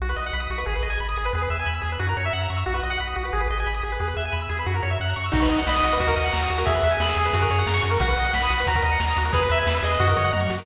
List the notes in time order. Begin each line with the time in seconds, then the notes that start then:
0.00 B1 F#4
0.09 B4
0.16 B1 D#5
0.26 F#5
0.33 B1 B5
0.40 D#6
0.50 B1 F#4
0.58 B4
0.66 G#1 G#4
0.75 B4
0.83 G#1 D#5
0.90 G#5
1.00 G#1 B5
1.09 D#6
1.17 G#1 G#4
1.25 B4
1.33 E2 G#4
1.42 B4
1.50 E2 E5
1.59 G#5
1.66 E2 B5
1.74 E6
1.82 E2 G#4
1.92 B4
1.99 F#2 F#4
2.09 A#4
2.17 F#2 C#5
2.25 E5
2.33 F#2 F#5
2.42 A#5
2.50 F#2 C#6
2.57 E6
2.66 B1 F#4
2.75 B4
2.83 B1 D#5
2.90 F#5
3.00 B1 B5
3.08 D#6
3.16 B1 F#4
3.25 B4
3.33 G#1 G#4
3.40 B4
3.50 G#1 D#5
3.60 G#5
3.66 G#1 B5
3.74 D#6
3.83 G#1 G#4
3.92 B4
4.00 E2 G#4
4.07 B4
4.17 E2 E5
4.25 G#5
4.32 E2 B5
4.42 E6
4.49 E2 G#4
4.59 B4
4.66 F#2 F#4
4.75 A#4
4.82 F#2 C#5
4.91 E5
5.00 F#2 F#5
5.09 A#5
5.16 F#2 C#6
5.26 E6
5.32 B1 D#4 F#4, kick, crash
5.42 B4, closed hi-hat
5.49 B1 D#5, closed hi-hat
5.58 F#5, closed hi-hat
5.67 B1 D#5 B5, snare
5.75 D#6, closed hi-hat
5.83 B1 F#4, closed hi-hat
5.92 B4, closed hi-hat
6.00 D#2 F#4, kick, closed hi-hat
6.07 A#4, kick, closed hi-hat
6.16 D#2 D#5, closed hi-hat
6.24 F#5, closed hi-hat
6.33 D#2 A#5, snare
6.42 D#6, closed hi-hat
6.50 D#2 F#4, closed hi-hat
6.58 A#4, closed hi-hat
6.65 E2 G#4 E5, kick, closed hi-hat
6.75 B4, closed hi-hat
6.83 E2 E5, closed hi-hat
6.91 G#5, closed hi-hat
7.00 E2 G#4 B5, snare
7.08 E6, closed hi-hat
7.17 E2 G#4, closed hi-hat
7.25 B4, closed hi-hat
7.33 F#2 F#4, kick, closed hi-hat
7.41 A#4, kick, closed hi-hat
7.50 F#2 C#5, closed hi-hat
7.58 F#5, closed hi-hat
7.67 F#2 A#5, snare
7.74 C#6, closed hi-hat
7.82 F#2 F#4, closed hi-hat
7.91 A#4, closed hi-hat
8.00 B1 F#4 F#5, kick, closed hi-hat
8.08 B4, closed hi-hat
8.17 B1 D#5, closed hi-hat
8.25 F#5, closed hi-hat
8.33 B1 B5, snare
8.42 D#6, closed hi-hat
8.50 B1 F#4, closed hi-hat
8.59 B4, closed hi-hat
8.67 D#2 F#4 A#5, kick, closed hi-hat
8.75 A#4, kick, closed hi-hat
8.82 D#2 D#5, closed hi-hat
8.91 F#5, closed hi-hat
9.00 D#2 A#5, snare
9.08 D#6, closed hi-hat
9.16 D#2 F#4, closed hi-hat
9.24 A#4, closed hi-hat
9.32 E2 G#4 B4, kick, closed hi-hat
9.42 B4, closed hi-hat
9.50 E2 B4 E5, closed hi-hat
9.58 G#5, closed hi-hat
9.67 E2 B5, snare
9.75 E6, closed hi-hat
9.82 E2 G#4 D#5, closed hi-hat
9.91 B4, closed hi-hat
10.00 F#2 F#4, kick, floor tom
10.08 A#4, floor tom
10.17 F#2 C#5, mid tom
10.24 F#5, mid tom
10.33 F#2 A#5, high tom
10.41 C#6, high tom
10.50 F#2 F#4, snare
10.58 A#4, snare